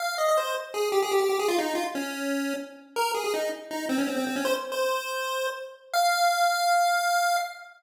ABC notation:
X:1
M:4/4
L:1/16
Q:1/4=162
K:Fm
V:1 name="Lead 1 (square)"
f2 e e c2 z2 A2 G A G G G A | F E2 F z D7 z4 | B2 A A E2 z2 E2 C D C C C D | c z2 c9 z4 |
f16 |]